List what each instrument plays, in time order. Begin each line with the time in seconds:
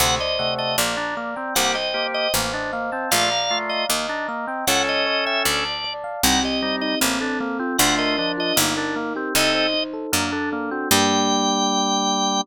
0.00 harpsichord D2, drawbar organ C3 A3 F#5, electric piano 1 C5
0.19 electric piano 1 D5, drawbar organ D#5
0.39 drawbar organ C3 A3, electric piano 1 F#5
0.58 drawbar organ D#5, electric piano 1 A5
0.78 harpsichord A#1, drawbar organ A#3, electric piano 1 D5
0.97 drawbar organ D4, electric piano 1 A#5
1.17 drawbar organ A#3, electric piano 1 D5
1.36 drawbar organ C4, electric piano 1 G5
1.55 harpsichord C2, drawbar organ A#3 G4 F#5, electric piano 1 C5
1.75 drawbar organ D#5, electric piano 1 G5
1.94 drawbar organ A#3 G4, electric piano 1 C5
2.14 electric piano 1 D#5, drawbar organ D#5
2.34 harpsichord A1, drawbar organ A#3, electric piano 1 C5
2.53 drawbar organ D4, electric piano 1 D#5
2.73 drawbar organ A#3, electric piano 1 F5
2.92 drawbar organ C4, electric piano 1 A5
3.11 harpsichord A#1, drawbar organ A3 F4 F5, electric piano 1 D5
3.31 electric piano 1 A#5
3.51 drawbar organ A3 F4, electric piano 1 D5
3.69 drawbar organ D#5, electric piano 1 F5
3.89 harpsichord D#2, drawbar organ A#3, electric piano 1 D#5
4.09 drawbar organ D4, electric piano 1 A#5
4.28 drawbar organ A#3, electric piano 1 D#5
4.47 drawbar organ C4, electric piano 1 G5
4.67 harpsichord C#2, drawbar organ C#4 A4 F#5, electric piano 1 C#5
4.87 drawbar organ D#5, electric piano 1 A5
5.06 electric piano 1 C#5
5.26 drawbar organ E5, electric piano 1 G5
5.45 harpsichord D2, drawbar organ D5, electric piano 1 D5
5.65 electric piano 1 A5
5.84 electric piano 1 D5
6.04 electric piano 1 F5
6.23 harpsichord C2, drawbar organ G3 D#4 F#5, electric piano 1 C4
6.43 electric piano 1 G4, drawbar organ D#5
6.62 drawbar organ G3 D#4, electric piano 1 C4
6.81 electric piano 1 D#4, drawbar organ D#5
7.01 harpsichord A1, drawbar organ A#3, electric piano 1 C4
7.21 drawbar organ D4, electric piano 1 A4
7.40 drawbar organ A#3, electric piano 1 C4
7.59 drawbar organ C4, electric piano 1 F4
7.78 harpsichord D2, drawbar organ A3 F4 F#5, electric piano 1 D4
7.98 electric piano 1 A#4, drawbar organ D#5
8.18 drawbar organ F3 D4, electric piano 1 D4
8.37 electric piano 1 F4, drawbar organ D#5
8.56 harpsichord G1, drawbar organ A#3, electric piano 1 D#4
8.77 drawbar organ D4, electric piano 1 A#4
8.96 drawbar organ A#3, electric piano 1 D#4
9.16 drawbar organ C4, electric piano 1 G4
9.35 harpsichord C2, drawbar organ C4 A4 D#5, electric piano 1 D#4
9.54 electric piano 1 C5
9.74 electric piano 1 D#4
9.93 electric piano 1 A4
10.12 harpsichord F#2, drawbar organ A#3, electric piano 1 D4
10.32 drawbar organ D4, electric piano 1 A4
10.52 drawbar organ A#3, electric piano 1 D4
10.71 drawbar organ C4, electric piano 1 F#4
10.91 harpsichord G2, drawbar organ G3 G5, electric piano 1 A#3 D4 G4